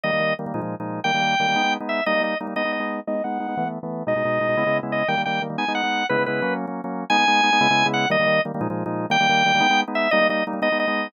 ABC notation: X:1
M:6/8
L:1/16
Q:3/8=119
K:G#m
V:1 name="Drawbar Organ"
d4 z8 | =g10 e2 | d2 d2 z2 d2 d4 | d2 f6 z4 |
d10 d2 | =g2 g2 z2 ^g2 f4 | B2 B4 z6 | g10 f2 |
d4 z8 | =g10 e2 | d2 d2 z2 d2 d4 |]
V:2 name="Drawbar Organ"
[D,=G,A,] [D,G,A,] [D,G,A,]2 [D,G,A,] [D,G,A,] [A,,^E,^G,D] [A,,E,G,D]2 [A,,E,G,D]3 | [D,=G,A,] [D,G,A,] [D,G,A,]2 [D,G,A,] [D,G,A,] [^G,B,D] [G,B,D]2 [G,B,D]3 | [=G,A,D] [G,A,D] [G,A,D]2 [G,A,D] [G,A,D] [^G,B,D] [G,B,D]2 [G,B,D]3 | [G,B,D] [G,B,D] [G,B,D]2 [G,B,D] [G,B,D] [E,=A,B,] [E,A,B,]2 [E,A,B,]3 |
[B,,G,D] [B,,G,D] [B,,G,D]2 [B,,G,D] [B,,G,D] [C,G,B,E] [C,G,B,E]2 [C,G,B,E]3 | [D,=G,A,] [D,G,A,] [D,G,A,]2 [D,G,A,] [D,G,A,] [^G,B,D] [G,B,D]2 [G,B,D]3 | [C,G,B,E] [C,G,B,E] [C,G,B,E]2 [F,A,C]3 [F,A,C]2 [F,A,C]3 | [G,B,D] [G,B,D] [G,B,D]2 [G,B,D] [G,B,D] [C,G,B,E] [C,G,B,E]2 [C,G,B,E]3 |
[D,=G,A,] [D,G,A,] [D,G,A,]2 [D,G,A,] [D,G,A,] [A,,^E,^G,D] [A,,E,G,D]2 [A,,E,G,D]3 | [D,=G,A,] [D,G,A,] [D,G,A,]2 [D,G,A,] [D,G,A,] [^G,B,D] [G,B,D]2 [G,B,D]3 | [=G,A,D] [G,A,D] [G,A,D]2 [G,A,D] [G,A,D] [^G,B,D] [G,B,D]2 [G,B,D]3 |]